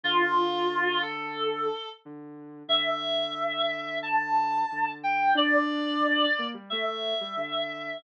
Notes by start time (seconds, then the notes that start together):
0.03 D3 F4
1.02 A4
2.05 D3
2.68 D3 E5
4.03 A5
4.72 D3
5.03 G5
5.35 D4 D5
6.39 A#3
6.54 G3
6.70 A3 E5
7.21 G3
7.37 D3